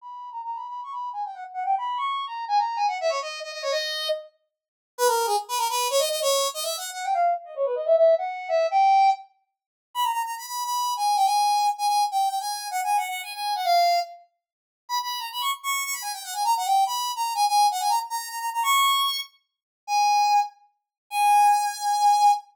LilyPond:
\new Staff { \time 3/4 \key gis \minor \tempo 4 = 145 b''8. ais''16 \tuplet 3/2 { ais''8 b''8 b''8 } cis'''16 b''8 gis''16 | g''16 fis''16 r16 fis''16 g''16 b''8 cis'''8. ais''8 | gis''16 ais''8 gis''16 fis''16 e''16 cis''16 dis''8 dis''16 dis''16 cis''16 | dis''4 r2 |
b'16 ais'8 gis'16 r16 b'16 ais'16 b'8 cis''16 dis''16 dis''16 | cis''8. dis''16 \tuplet 3/2 { e''8 fis''8 fis''8 } g''16 eis''8 r16 | dis''16 cis''16 b'16 dis''16 e''16 e''8 fis''8. e''8 | g''4 r2 |
b''16 ais''16 ais''16 ais''16 b''16 b''8 b''8. gis''8 | g''16 gis''4~ gis''16 gis''16 gis''8 g''8 g''16 | gis''8. fis''16 \tuplet 3/2 { gis''8 fis''8 fis''8 } gis''16 gis''8 fis''16 | eis''4 r2 |
b''16 b''8 ais''16 b''16 cis'''16 r16 cis'''8 cis'''16 b''16 gis''16 | g''16 fis''16 gis''16 ais''16 fis''16 g''8 b''8. ais''8 | gis''16 gis''8 fis''16 gis''16 ais''16 r16 ais''8 ais''16 ais''16 ais''16 | cis'''4. r4. |
gis''4. r4. | gis''2. | }